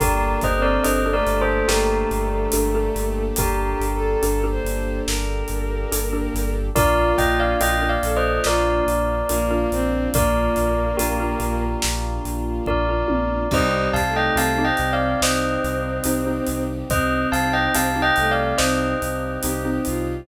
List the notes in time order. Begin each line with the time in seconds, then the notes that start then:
0.00 G1 A#3 D4 G4 A4 A#4, kick, closed hi-hat
0.41 G1 C5 D#5, kick, closed hi-hat
0.56 C4
0.62 A#4 D5
0.84 G1 D4 G4 A4 A#4 C5 D#5, closed hi-hat
1.06 D4 G4 A4 A#4
1.13 A3 A#4 D5
1.26 G1, closed hi-hat
1.41 A4 C5
1.68 G1 A3 G4 A#4, snare
2.11 G1, closed hi-hat
2.52 G1 D4 G4 A4 A#4, closed hi-hat
2.75 D4 G4 A4 A#4
2.96 G1, closed hi-hat
3.36 G1 G4 A#4, kick, closed hi-hat
3.80 G1, closed hi-hat
3.95 A4
4.22 G1 D4 G4 A4 A#4, closed hi-hat
4.43 D4 G4 A4 A#4
4.51 C5
4.64 G1, closed hi-hat
5.07 G1 A#4, snare
5.48 G1, closed hi-hat
5.92 G1 D4 G4 A4 A#4, closed hi-hat
6.13 D4 G4 A4 A#4
6.34 G1, closed hi-hat
6.76 A#1 A#3 D4 F4 A#4 D5, kick, closed hi-hat
7.18 A#1 D#5 G5, kick, closed hi-hat
7.40 D5 F5
7.61 A#1 D4 F4 A#4 D#5 G5, closed hi-hat
7.82 D4 F4 A#4
7.89 D5 F5
8.03 A#1 A4, closed hi-hat
8.17 C5 D#5
8.44 A#1 F4 A#4 D5, snare
8.87 A#1, closed hi-hat
9.29 A#1 A#3 D4 F4 A#4, closed hi-hat
9.51 D4 F4 A#4
9.72 A#1 C4, closed hi-hat
10.14 A#1 A#3 A#4 D5, kick, closed hi-hat
10.56 A#1, closed hi-hat
10.97 A#1 D4 F4 G4 A#4, closed hi-hat
11.20 D4 F4 A#4
11.40 A#1, closed hi-hat
11.82 A#1, snare
12.24 A#1, closed hi-hat
12.66 A#1 D4 F4 A#4 D5, kick
12.89 D4 F4 A#4
13.08 A#1, high tom
13.51 C2 G3 C4 D#4 G4 C5 D#5, kick, crash
13.93 C2 F5 A5, kick, closed hi-hat
14.09 A3
14.16 D#5 G5
14.36 C2 C4 D#4 G4 F5 A5, closed hi-hat
14.58 C4 D#4 G4
14.64 C4 D#5 G5
14.77 C2, closed hi-hat
14.93 D5 F5
15.21 C2 C4 C5 D#5, snare
15.64 C2, closed hi-hat
16.04 C2 C4 D#4 G4, closed hi-hat
16.27 C4 D#4 G4
16.46 C2, closed hi-hat
16.90 C2 C4 C5 D#5, kick, closed hi-hat
17.32 C2 F5 A5, closed hi-hat
17.53 D#5 G5
17.74 C2 C4 D#4 G4 F5 A5, closed hi-hat
17.96 C4 D#4 G4
18.02 D#5 G5
18.16 C2 A3, closed hi-hat
18.31 D5 F5
18.58 C2 C4 C5 D#5, snare
19.02 C2, closed hi-hat
19.43 C2 C4 D#4 G4, closed hi-hat
19.65 C4 D#4 G4
19.85 C2 F4, closed hi-hat